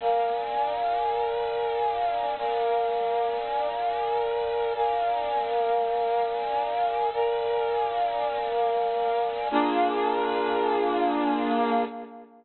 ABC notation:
X:1
M:12/8
L:1/8
Q:3/8=101
K:Bb
V:1 name="Brass Section"
[Bdf_a]12 | [Bdf_a]12 | [Bdf_a]12 | [Bdf_a]12 |
[B,DF_A]12 |]